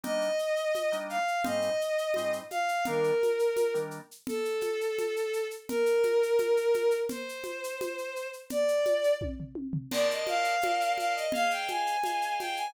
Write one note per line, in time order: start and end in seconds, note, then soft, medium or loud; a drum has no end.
0.03 0.28 G3 loud
0.03 0.28 A#3 medium
0.03 0.28 D4 medium
0.03 0.28 D#4 medium
0.03 0.95 D#5 medium
0.03 low conga medium
0.03 shaker medium
0.21 shaker soft
0.39 shaker medium
0.56 shaker soft
0.75 high conga medium
0.75 shaker medium
0.92 1.17 G3 medium
0.92 1.17 A#3 medium
0.92 1.17 D4 medium
0.92 1.17 D#4 medium
0.92 shaker medium
1.09 1.43 F5 medium
1.09 shaker soft
1.28 shaker soft
1.44 1.69 G#2 loud
1.44 1.69 G3 medium
1.44 1.69 C4 medium
1.44 1.69 D#4 medium
1.44 2.30 D#5 medium
1.44 low conga medium
1.44 shaker medium
1.62 shaker medium
1.81 shaker medium
1.98 shaker medium
2.14 2.40 G#2 medium
2.14 2.40 G3 medium
2.14 2.40 C4 medium
2.14 2.40 D#4 medium
2.14 high conga medium
2.14 shaker medium
2.33 shaker medium
2.50 2.84 F5 medium
2.50 high conga medium
2.50 shaker medium
2.68 shaker medium
2.85 3.11 D#3 loud
2.85 3.11 G3 medium
2.85 3.11 A#3 medium
2.85 3.11 D4 loud
2.85 3.73 A#4 medium
2.85 low conga medium
2.85 shaker medium
3.04 shaker soft
3.23 high conga medium
3.23 shaker medium
3.39 shaker medium
3.56 high conga medium
3.56 shaker medium
3.74 3.99 D#3 medium
3.74 3.99 G3 medium
3.74 3.99 A#3 medium
3.74 3.99 D4 medium
3.74 shaker medium
3.91 shaker soft
4.11 shaker medium
4.27 5.44 A4 loud
4.27 low conga medium
4.27 shaker medium
4.45 shaker medium
4.61 high conga medium
4.61 shaker medium
4.81 shaker medium
4.98 high conga medium
4.98 shaker medium
5.16 shaker medium
5.33 shaker medium
5.51 shaker medium
5.69 6.95 A#4 medium
5.69 low conga medium
5.69 shaker medium
5.86 shaker medium
6.03 high conga medium
6.03 shaker medium
6.23 shaker medium
6.38 high conga medium
6.38 shaker medium
6.57 shaker medium
6.74 high conga medium
6.74 shaker medium
6.91 shaker medium
7.09 8.27 C5 medium
7.09 low conga medium
7.09 shaker medium
7.29 shaker medium
7.44 high conga medium
7.44 shaker medium
7.64 shaker medium
7.81 high conga medium
7.81 shaker medium
7.98 shaker soft
8.16 shaker medium
8.33 shaker soft
8.50 9.12 D5 medium
8.50 low conga medium
8.50 shaker medium
8.68 shaker medium
8.85 high conga medium
8.85 shaker medium
9.04 shaker medium
9.21 kick medium
9.21 high tom medium
9.40 floor tom medium
9.55 high tom medium
9.73 floor tom medium
9.91 10.55 A#4 medium
9.91 10.55 C5 medium
9.91 10.55 D5 medium
9.91 10.07 D5 loud
9.91 10.55 A5 loud
9.91 crash medium
9.91 low conga medium
9.91 shaker medium
10.10 10.27 D#5 medium
10.10 shaker medium
10.27 10.92 F5 medium
10.27 high conga medium
10.27 shaker medium
10.44 shaker medium
10.61 11.26 A#4 medium
10.61 11.26 C5 medium
10.61 11.26 D5 medium
10.61 11.26 A5 medium
10.61 high conga medium
10.61 shaker medium
10.81 shaker medium
10.98 11.13 F5 medium
10.98 high conga medium
10.98 shaker medium
11.15 11.31 D#5 medium
11.15 shaker medium
11.32 11.97 G#4 medium
11.32 11.97 C5 medium
11.32 11.97 D#5 medium
11.32 11.97 F5 loud
11.32 11.50 F5 loud
11.32 low conga medium
11.32 shaker medium
11.50 11.67 G5 medium
11.50 shaker medium
11.68 12.34 G#5 medium
11.68 high conga medium
11.68 shaker medium
11.87 shaker medium
12.04 12.67 G#4 medium
12.04 12.67 C5 medium
12.04 12.67 D#5 medium
12.04 12.67 F5 medium
12.04 high conga medium
12.04 shaker medium
12.22 shaker medium
12.39 12.54 G5 medium
12.39 high conga medium
12.39 shaker medium
12.56 12.72 G#5 medium
12.56 shaker medium